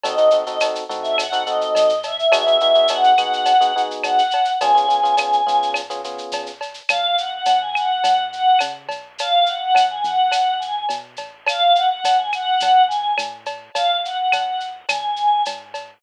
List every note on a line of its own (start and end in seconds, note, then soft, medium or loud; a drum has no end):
0.03 0.77 D#2 medium
0.03 0.16 C4 loud
0.03 0.16 D#4 loud
0.03 0.16 F#4 loud
0.03 0.16 A4 loud
0.03 0.38 D#5 medium
0.03 cowbell medium
0.03 shaker loud
0.17 0.29 C4 medium
0.17 0.29 D#4 loud
0.17 0.29 F#4 medium
0.17 0.29 A4 medium
0.17 shaker medium
0.30 0.43 C4 loud
0.30 0.43 D#4 medium
0.30 0.43 F#4 medium
0.30 0.43 A4 medium
0.30 shaker medium
0.45 0.58 C4 medium
0.45 0.58 D#4 loud
0.45 0.58 F#4 medium
0.45 0.58 A4 medium
0.45 0.59 D#5 medium
0.45 shaker medium
0.60 0.84 C4 medium
0.60 0.84 D#4 medium
0.60 0.84 F#4 medium
0.60 0.84 A4 medium
0.60 cowbell medium
0.60 claves medium
0.60 shaker loud
0.75 shaker medium
0.89 1.63 A2 medium
0.89 1.24 C4 medium
0.89 1.24 D#4 medium
0.89 1.24 F#4 medium
0.89 1.24 A4 medium
0.89 shaker medium
1.02 1.16 E5 medium
1.02 shaker medium
1.18 1.46 F#5 medium
1.18 cowbell medium
1.18 claves loud
1.18 shaker loud
1.32 1.44 C4 medium
1.32 1.44 D#4 loud
1.32 1.44 F#4 medium
1.32 1.44 A4 medium
1.32 shaker medium
1.46 1.93 C4 medium
1.46 1.93 D#4 medium
1.46 1.93 F#4 medium
1.46 1.93 A4 loud
1.46 2.00 D#5 medium
1.46 shaker medium
1.61 shaker medium
1.75 2.24 G#2 medium
1.75 cowbell medium
1.75 shaker loud
1.89 shaker medium
2.03 2.32 E5 medium
2.03 cowbell medium
2.03 shaker medium
2.19 shaker medium
2.32 3.05 G#1 medium
2.32 2.44 B3 medium
2.32 2.44 D#4 loud
2.32 2.44 F#4 loud
2.32 2.44 G#4 loud
2.32 2.88 E5 medium
2.32 cowbell loud
2.32 claves loud
2.32 shaker loud
2.47 2.58 B3 medium
2.47 2.58 D#4 medium
2.47 2.58 F#4 medium
2.47 2.58 G#4 medium
2.47 shaker medium
2.60 2.73 B3 loud
2.60 2.73 D#4 loud
2.60 2.73 F#4 medium
2.60 2.73 G#4 medium
2.60 shaker medium
2.75 2.87 B3 medium
2.75 2.87 D#4 medium
2.75 2.87 F#4 medium
2.75 2.87 G#4 medium
2.75 shaker medium
2.88 3.13 B3 medium
2.88 3.13 D#4 medium
2.88 3.13 F#4 medium
2.88 3.13 G#4 medium
2.88 3.81 F#5 medium
2.88 cowbell medium
2.88 shaker loud
3.04 shaker medium
3.18 3.91 D#2 medium
3.18 3.53 B3 loud
3.18 3.53 D#4 medium
3.18 3.53 F#4 medium
3.18 3.53 G#4 medium
3.18 claves medium
3.18 shaker loud
3.33 shaker medium
3.45 cowbell medium
3.45 shaker loud
3.60 3.72 B3 loud
3.60 3.72 D#4 medium
3.60 3.72 F#4 medium
3.60 3.72 G#4 medium
3.60 shaker medium
3.76 4.21 B3 medium
3.76 4.21 D#4 loud
3.76 4.21 F#4 medium
3.76 4.21 G#4 medium
3.76 shaker medium
3.91 shaker medium
4.03 4.52 C#2 medium
4.03 4.51 F#5 medium
4.03 cowbell medium
4.03 claves medium
4.03 shaker loud
4.18 shaker medium
4.31 cowbell medium
4.31 shaker medium
4.45 shaker medium
4.60 5.34 C#2 medium
4.60 4.73 B3 loud
4.60 4.73 C#4 loud
4.60 4.73 F4 medium
4.60 4.73 G#4 loud
4.60 5.69 G#5 medium
4.60 cowbell loud
4.60 shaker loud
4.75 4.86 B3 medium
4.75 4.86 C#4 loud
4.75 4.86 F4 medium
4.75 4.86 G#4 loud
4.75 shaker medium
4.88 5.00 B3 medium
4.88 5.00 C#4 medium
4.88 5.00 F4 medium
4.88 5.00 G#4 medium
4.88 shaker medium
5.03 5.15 B3 medium
5.03 5.15 C#4 medium
5.03 5.15 F4 loud
5.03 5.15 G#4 medium
5.03 shaker medium
5.17 5.41 B3 medium
5.17 5.41 C#4 medium
5.17 5.41 F4 medium
5.17 5.41 G#4 medium
5.17 cowbell medium
5.17 claves loud
5.17 shaker loud
5.33 shaker medium
5.47 6.20 G#2 medium
5.47 5.81 B3 medium
5.47 5.81 C#4 medium
5.47 5.81 F4 medium
5.47 5.81 G#4 medium
5.47 shaker medium
5.63 shaker medium
5.74 cowbell medium
5.74 claves medium
5.74 shaker loud
5.90 6.01 B3 medium
5.90 6.01 C#4 medium
5.90 6.01 F4 medium
5.90 6.01 G#4 medium
5.90 shaker medium
6.04 6.50 B3 medium
6.04 6.50 C#4 medium
6.04 6.50 F4 medium
6.04 6.50 G#4 medium
6.04 shaker medium
6.18 shaker medium
6.32 6.81 C#2 medium
6.32 cowbell medium
6.32 shaker loud
6.46 shaker medium
6.61 cowbell medium
6.61 shaker medium
6.74 shaker medium
6.89 7.41 C#2 medium
6.89 7.16 F5 medium
6.89 cowbell medium
6.89 claves loud
6.89 shaker loud
7.18 7.31 F#5 medium
7.18 shaker medium
7.34 7.58 F#5 medium
7.45 7.98 G#2 medium
7.45 cowbell medium
7.45 shaker loud
7.60 7.74 G#5 medium
7.75 8.24 F#5 medium
7.75 claves loud
7.75 shaker medium
8.04 8.55 F#2 medium
8.04 cowbell medium
8.04 shaker loud
8.32 8.60 F#5 medium
8.32 shaker medium
8.59 8.88 C#3 medium
8.59 cowbell medium
8.59 claves medium
8.59 shaker loud
8.89 9.70 B1 medium
8.89 cowbell medium
8.89 shaker medium
9.18 9.46 F5 medium
9.18 cowbell medium
9.18 shaker loud
9.46 9.59 F#5 medium
9.46 shaker medium
9.59 9.86 F#5 medium
9.75 10.02 F#2 medium
9.75 cowbell medium
9.75 claves medium
9.75 shaker loud
9.90 10.04 G#5 medium
10.04 10.84 E2 medium
10.04 10.56 F#5 medium
10.04 shaker medium
10.31 cowbell medium
10.31 claves medium
10.31 shaker loud
10.59 10.84 G#5 medium
10.59 shaker medium
10.89 11.17 B2 medium
10.89 cowbell medium
10.89 shaker loud
11.16 11.98 A1 medium
11.16 cowbell medium
11.16 shaker medium
11.46 11.75 F5 medium
11.46 cowbell loud
11.46 claves loud
11.46 shaker loud
11.75 11.89 F#5 medium
11.75 shaker medium
11.90 12.17 F#5 medium
12.04 12.55 E2 medium
12.04 cowbell medium
12.04 shaker loud
12.17 12.30 G#5 medium
12.32 12.82 F#5 medium
12.32 claves medium
12.32 shaker medium
12.60 13.13 D#2 medium
12.60 cowbell medium
12.60 shaker loud
12.88 13.13 G#5 medium
12.88 shaker medium
13.18 13.70 A2 medium
13.18 cowbell medium
13.18 claves loud
13.18 shaker loud
13.46 cowbell medium
13.46 shaker medium
13.74 14.27 G#1 medium
13.74 13.97 F5 medium
13.74 cowbell loud
13.74 shaker loud
14.04 14.17 F#5 medium
14.04 shaker medium
14.17 14.42 F#5 medium
14.32 14.84 D#2 medium
14.32 cowbell medium
14.32 claves loud
14.32 shaker loud
14.46 14.60 F#5 medium
14.60 shaker medium
14.89 15.41 C#2 medium
14.89 15.44 G#5 medium
14.89 cowbell medium
14.89 claves loud
14.89 shaker loud
15.16 shaker medium
15.45 15.98 G#2 medium
15.45 cowbell medium
15.45 shaker loud
15.74 cowbell medium
15.74 shaker medium